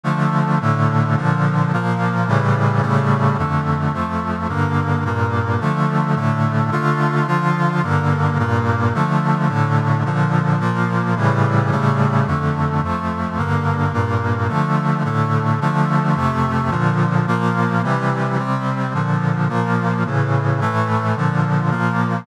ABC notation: X:1
M:4/4
L:1/8
Q:1/4=108
K:Dm
V:1 name="Brass Section"
[D,F,A,]2 [A,,D,A,]2 [B,,D,F,]2 [B,,F,B,]2 | [A,,^C,E,G,]2 [A,,C,G,A,]2 [F,,D,A,]2 [F,,F,A,]2 | [G,,D,B,]2 [G,,B,,B,]2 [D,F,A,]2 [A,,D,A,]2 | [D,A,F]2 [D,F,F]2 [G,,D,B,]2 [G,,B,,B,]2 |
[D,F,A,]2 [A,,D,A,]2 [B,,D,F,]2 [B,,F,B,]2 | [A,,^C,E,G,]2 [A,,C,G,A,]2 [F,,D,A,]2 [F,,F,A,]2 | [G,,D,B,]2 [G,,B,,B,]2 [D,F,A,]2 [A,,D,A,]2 | [D,F,A,]2 [F,,C,A,]2 [B,,D,F,]2 [B,,F,B,]2 |
[C,E,G,]2 [C,G,C]2 [B,,D,F,]2 [B,,F,B,]2 | [A,,^C,E,]2 [A,,E,A,]2 [B,,D,F,]2 [B,,F,B,]2 |]